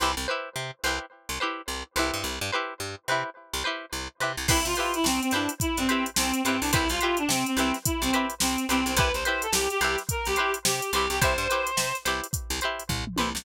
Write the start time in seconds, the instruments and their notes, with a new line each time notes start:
0.00 electric bass (finger) C2, pizzicato strings E4 G4 B4 C5
0.17 electric bass (finger) C2
0.28 pizzicato strings E4 G4 B4 C5
0.56 electric bass (finger) C3
0.84 electric bass (finger) C2, pizzicato strings E4 G4 B4 C5
1.29 electric bass (finger) C2
1.40 pizzicato strings E4 G4 B4 C5
1.68 electric bass (finger) C2
1.96 electric bass (finger) C2, pizzicato strings E4 G4 B4 C5
2.14 electric bass (finger) G2
2.24 electric bass (finger) C2
2.41 electric bass (finger) G2
2.52 pizzicato strings E4 G4 B4 C5
2.80 electric bass (finger) G2
3.08 electric bass (finger) C3, pizzicato strings E4 G4 B4 C5
3.54 electric bass (finger) C2
3.64 pizzicato strings E4 G4 B4 C5
3.93 electric bass (finger) C2
4.20 electric bass (finger) C3, pizzicato strings E4 G4 B4 C5
4.37 electric bass (finger) C2
4.48 electric bass (finger) C2, clarinet E4, pizzicato strings E4 G4 B4 C5, kick, crash
4.65 electric bass (finger) C3, clarinet F4, closed hi-hat
4.75 clarinet F4, pizzicato strings G4 B4 C5, closed hi-hat
4.80 pizzicato strings E4
4.94 clarinet E4, closed hi-hat
5.04 electric bass (finger) C2, clarinet C4, snare
5.21 clarinet C4, closed hi-hat
5.31 electric bass (finger) G2, clarinet D4, pizzicato strings G4 B4 C5, snare, closed hi-hat
5.36 pizzicato strings E4
5.49 closed hi-hat
5.60 clarinet E4, kick, closed hi-hat
5.77 electric bass (finger) G2, clarinet C4, snare, closed hi-hat
5.89 pizzicato strings E4 G4 B4 C5, closed hi-hat
6.06 closed hi-hat
6.16 electric bass (finger) C2, clarinet C4, snare
6.34 closed hi-hat
6.44 electric bass (finger) G2, clarinet C4, pizzicato strings G4 B4 C5, snare, closed hi-hat
6.48 pizzicato strings E4
6.61 electric bass (finger) C2, clarinet D4, open hi-hat
6.72 electric bass (finger) C2, clarinet E4, pizzicato strings E4 G4 B4 C5, kick, closed hi-hat
6.89 electric bass (finger) C2, clarinet F4, snare, closed hi-hat
7.01 pizzicato strings E4 G4 B4 C5, clarinet F4, closed hi-hat
7.17 clarinet D4, closed hi-hat
7.29 electric bass (finger) C3, clarinet C4, snare
7.46 clarinet C4, closed hi-hat
7.57 electric bass (finger) C2, clarinet C4, pizzicato strings E4 G4 B4 C5, closed hi-hat
7.74 snare, closed hi-hat
7.85 clarinet E4, kick, closed hi-hat
8.02 electric bass (finger) C2, clarinet C4, closed hi-hat
8.13 pizzicato strings E4 G4 B4 C5, closed hi-hat
8.30 closed hi-hat
8.40 electric bass (finger) C2, clarinet C4, snare
8.58 closed hi-hat
8.69 electric bass (finger) C2, clarinet C4, pizzicato strings E4 G4 B4 C5, closed hi-hat
8.86 electric bass (finger) C2, clarinet C4, closed hi-hat
8.96 electric bass (finger) C2, pizzicato strings E4 G4 B4 C5, clarinet B4, kick, closed hi-hat
9.14 electric bass (finger) C2, clarinet C5, closed hi-hat
9.25 pizzicato strings E4 G4 B4 C5, clarinet C5, closed hi-hat
9.42 clarinet A4, closed hi-hat
9.52 electric bass (finger) C2, clarinet G4, snare
9.70 clarinet G4, closed hi-hat
9.81 electric bass (finger) C2, pizzicato strings E4 G4 B4 C5, clarinet G4, closed hi-hat
9.98 snare, closed hi-hat
10.09 clarinet A#4, kick, closed hi-hat
10.25 electric bass (finger) C2, clarinet G4, closed hi-hat
10.36 pizzicato strings G4 B4 C5, closed hi-hat
10.40 pizzicato strings E4
10.54 closed hi-hat
10.65 electric bass (finger) C3, clarinet G4, snare
10.82 closed hi-hat
10.92 electric bass (finger) C2, clarinet G4, pizzicato strings G4 B4 C5, closed hi-hat
10.97 pizzicato strings E4
11.10 electric bass (finger) C2, clarinet G4, snare, closed hi-hat
11.21 electric bass (finger) C2, pizzicato strings E4 G4 B4 C5, clarinet C5, kick, closed hi-hat
11.38 electric bass (finger) G2, closed hi-hat
11.50 pizzicato strings E4 G4 B4 C5, closed hi-hat
11.67 closed hi-hat
11.77 electric bass (finger) C3, snare
11.95 closed hi-hat
12.05 electric bass (finger) C2, pizzicato strings E4 G4 B4 C5, closed hi-hat
12.24 closed hi-hat
12.33 kick, closed hi-hat
12.50 electric bass (finger) C2, closed hi-hat
12.61 pizzicato strings E4 G4 B4 C5, closed hi-hat
12.80 closed hi-hat
12.89 electric bass (finger) C2, kick, floor tom
13.07 mid tom
13.16 electric bass (finger) C2, pizzicato strings G4 B4 C5, high tom
13.21 pizzicato strings E4
13.35 electric bass (finger) C2, snare